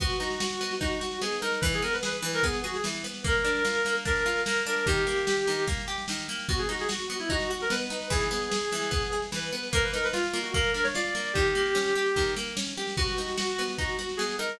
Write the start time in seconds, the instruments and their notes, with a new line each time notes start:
0.00 orchestral harp B3, clarinet F#4, kick, snare
0.10 snare
0.20 orchestral harp D#4, snare
0.30 snare
0.40 orchestral harp F#4, snare
0.50 snare
0.61 orchestral harp B3, snare
0.71 snare
0.81 orchestral harp D#4, clarinet F#4, kick, snare
0.91 snare
1.01 orchestral harp F#4, snare
1.11 snare
1.21 orchestral harp B3, clarinet G#4, snare
1.32 snare
1.41 orchestral harp D#4, clarinet A#4, snare
1.52 snare
1.61 orchestral harp E3, clarinet B4, kick, snare
1.72 clarinet G#4, snare
1.82 orchestral harp B3, clarinet A#4, snare
1.93 clarinet B4, snare
2.03 orchestral harp G#4, clarinet B4, snare
2.13 snare
2.22 orchestral harp E3, snare
2.33 clarinet A#4, snare
2.43 orchestral harp B3, clarinet G#4, kick, snare
2.53 snare
2.64 clarinet F#4, orchestral harp G#4, snare
2.74 clarinet G#4, snare
2.84 orchestral harp E3, snare
2.94 snare
3.04 orchestral harp B3, snare
3.14 snare
3.24 orchestral harp A#3, clarinet A#4, kick, snare
3.34 snare
3.45 orchestral harp D4, snare
3.55 snare
3.65 orchestral harp F4, snare
3.75 snare
3.85 orchestral harp A#3, snare
3.95 snare
4.05 orchestral harp D4, clarinet A#4, kick, snare
4.16 snare
4.26 orchestral harp F4, snare
4.36 snare
4.45 orchestral harp A#3, clarinet A#4, snare
4.56 snare
4.66 orchestral harp D4, clarinet A#4, snare
4.76 snare
4.86 orchestral harp D#3, clarinet G4, kick, snare
4.97 snare
5.07 orchestral harp A#3, snare
5.17 snare
5.27 orchestral harp G4, snare
5.37 snare
5.47 orchestral harp D#3, snare
5.58 snare
5.67 orchestral harp A#3, kick, snare
5.77 snare
5.88 orchestral harp G4, snare
5.98 snare
6.08 orchestral harp D#3, snare
6.18 snare
6.28 orchestral harp A#3, snare
6.39 snare
6.49 orchestral harp B3, clarinet F#4, kick, snare
6.58 clarinet G#4, snare
6.69 orchestral harp D#4, clarinet F#4, snare
6.79 clarinet G#4, snare
6.89 orchestral harp F#4, clarinet F#4, snare
6.99 snare
7.10 orchestral harp B3, snare
7.19 clarinet E4, snare
7.30 orchestral harp D#4, clarinet F#4, kick, snare
7.40 snare
7.49 clarinet F#4, orchestral harp F#4, snare
7.60 clarinet A#4, snare
7.70 orchestral harp B3, clarinet B4, snare
7.80 snare
7.90 orchestral harp D#4, snare
8.01 snare
8.10 orchestral harp E3, clarinet G#4, kick, snare
8.21 snare
8.31 orchestral harp B3, snare
8.41 snare
8.52 orchestral harp G#4, snare
8.61 snare
8.72 orchestral harp E3, snare
8.82 snare
8.91 orchestral harp B3, kick, snare
9.02 snare
9.12 orchestral harp G#4, snare
9.22 snare
9.32 orchestral harp E3, clarinet B4, snare
9.42 snare
9.52 orchestral harp B3, snare
9.63 snare
9.73 orchestral harp A#3, clarinet A#4, kick, snare
9.83 clarinet B4, snare
9.93 orchestral harp D#4, clarinet A#4, snare
10.04 clarinet B4, snare
10.13 clarinet F4, orchestral harp F4, snare
10.24 snare
10.33 orchestral harp A#3, snare
10.42 clarinet F#4, snare
10.54 orchestral harp A#3, clarinet A#4, kick, snare
10.64 snare
10.74 orchestral harp D4, clarinet A#4, snare
10.83 clarinet C#5, snare
10.94 orchestral harp F4, clarinet D5, snare
11.05 snare
11.15 orchestral harp A#3, snare
11.25 snare
11.33 orchestral harp D#3, clarinet G4, kick, snare
11.45 snare
11.55 orchestral harp A#3, snare
11.66 snare
11.75 orchestral harp C#4, snare
11.86 snare
11.95 orchestral harp G4, snare
12.06 snare
12.16 orchestral harp D#3, kick, snare
12.26 snare
12.36 orchestral harp A#3, snare
12.47 snare
12.57 orchestral harp C#4, snare
12.67 snare
12.77 orchestral harp G4, snare
12.87 snare
12.97 orchestral harp B3, clarinet F#4, kick, snare
13.07 snare
13.18 orchestral harp D#4, snare
13.28 snare
13.37 orchestral harp F#4, snare
13.48 snare
13.58 orchestral harp B3, snare
13.68 snare
13.78 orchestral harp D#4, clarinet F#4, kick, snare
13.89 snare
13.99 orchestral harp F#4, snare
14.09 snare
14.17 orchestral harp B3, clarinet G#4, snare
14.29 snare
14.38 orchestral harp D#4, clarinet A#4, snare
14.49 snare